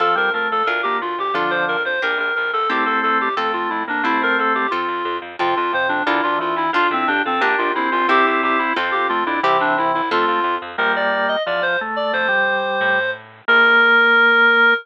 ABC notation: X:1
M:2/2
L:1/8
Q:1/2=89
K:F
V:1 name="Clarinet"
A B B A B G F G | F c B c B B B A | G A A G A F E D | E B A G F3 z |
F F c D E F F E | F C D C D F E F | G G G E F G F E | G D E E F3 z |
[K:Bb] B d2 e d c z d | c6 z2 | B8 |]
V:2 name="Drawbar Organ"
F, G, A,2 z B, z2 | [D,F,]3 z5 | [A,C]4 A,2 A, B, | [A,C]4 z4 |
C, z C,2 D, D, E,2 | F E G A D2 C2 | [CE]4 C2 A, D | [C,E,]4 A,2 z2 |
[K:Bb] [G,B,]4 F, F, A,2 | A, G,5 z2 | B,8 |]
V:3 name="Orchestral Harp"
[CFA]4 [DFB]4 | [DFA]4 [DGB]4 | [CEG]4 [CFA]4 | [CEG]4 [CFA]4 |
[CFA]4 [DFB]4 | [DFA]4 [DGB]4 | [CEG]4 [CFA]4 | [CEG]4 [CFA]4 |
[K:Bb] z8 | z8 | z8 |]
V:4 name="Electric Bass (finger)" clef=bass
F,, F,, F,, F,, D,, D,, D,, D,, | F,, F,, F,, F,, B,,, B,,, B,,, B,,, | C,, C,, C,, C,, F,, F,, F,, F,, | C,, C,, C,, C,, F,, F,, F,, F,, |
F,, F,, F,, F,, D,, D,, D,, D,, | F,, F,, F,, F,, B,,, B,,, B,,, B,,, | C,, C,, C,, C,, F,, F,, F,, F,, | C,, C,, C,, C,, F,, F,, F,, F,, |
[K:Bb] B,,,4 =E,,4 | F,,4 A,,4 | B,,,8 |]